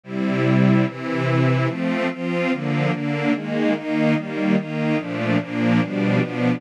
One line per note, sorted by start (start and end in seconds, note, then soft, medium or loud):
0.04 0.85 C3 medium
0.04 0.85 G3 medium
0.04 0.85 E4 medium
0.86 1.68 C3 medium
0.86 1.68 E3 medium
0.86 1.68 E4 loud
1.67 2.08 F3 loud
1.67 2.08 A3 loud
1.67 2.08 C4 loud
2.11 2.50 F3 loud
2.11 2.52 C4 loud
2.11 2.52 F4 medium
2.51 2.91 D3 loud
2.51 2.92 F3 medium
2.51 2.91 A#3 medium
2.92 3.32 D3 loud
2.92 3.32 A#3 loud
2.92 3.32 D4 medium
3.33 3.73 D#3 medium
3.33 3.74 G#3 medium
3.33 3.73 A#3 medium
3.74 4.15 D#3 medium
3.74 4.15 A#3 loud
3.74 4.15 D#4 medium
4.15 4.56 D#3 medium
4.15 4.56 G3 medium
4.15 4.56 A#3 medium
4.56 4.97 D#3 loud
4.56 4.97 A#3 medium
4.56 4.97 D#4 medium
4.97 5.37 A#2 medium
4.97 5.37 F3 loud
4.97 5.37 A3 medium
4.97 5.37 D4 medium
5.40 5.81 A#2 medium
5.40 5.81 F3 loud
5.40 5.81 A#3 medium
5.40 5.81 D4 loud
5.81 6.20 B2 medium
5.81 6.20 F3 medium
5.81 6.22 G3 medium
5.81 6.20 D4 loud
6.21 6.61 B2 loud
6.21 6.61 F3 loud
6.21 6.61 B3 medium
6.21 6.61 D4 loud